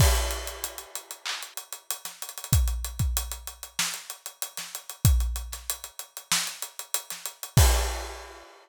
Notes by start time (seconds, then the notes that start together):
0.00 kick, crash
0.15 closed hi-hat
0.31 snare, closed hi-hat
0.47 closed hi-hat
0.64 closed hi-hat
0.78 closed hi-hat
0.95 closed hi-hat
1.11 closed hi-hat
1.26 clap
1.43 closed hi-hat
1.57 closed hi-hat
1.73 closed hi-hat
1.91 closed hi-hat
2.05 snare, closed hi-hat
2.22 closed hi-hat
2.29 closed hi-hat
2.38 closed hi-hat
2.44 closed hi-hat
2.53 kick, closed hi-hat
2.68 closed hi-hat
2.84 closed hi-hat
2.99 kick, closed hi-hat
3.17 closed hi-hat
3.31 closed hi-hat
3.47 closed hi-hat
3.63 closed hi-hat
3.79 snare
3.94 closed hi-hat
4.10 closed hi-hat
4.26 closed hi-hat
4.42 closed hi-hat
4.57 snare, closed hi-hat
4.75 closed hi-hat
4.89 closed hi-hat
5.05 kick, closed hi-hat
5.20 closed hi-hat
5.36 closed hi-hat
5.52 snare, closed hi-hat
5.70 closed hi-hat
5.84 closed hi-hat
5.99 closed hi-hat
6.17 closed hi-hat
6.32 snare
6.47 closed hi-hat
6.62 closed hi-hat
6.79 closed hi-hat
6.94 closed hi-hat
7.10 snare, closed hi-hat
7.26 closed hi-hat
7.43 closed hi-hat
7.57 kick, crash